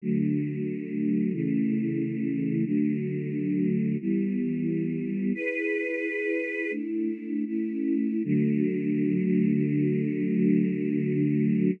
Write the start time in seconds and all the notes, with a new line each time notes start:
0.02 D3 F#3 A3
1.32 C#3 E3 A3
2.65 D3 F#3 A3
4.00 E3 G3 B3
5.34 E4 G#4 B4
6.71 A3 D4 E4
7.46 A3 C#4 E4
8.24 D3 F#3 A3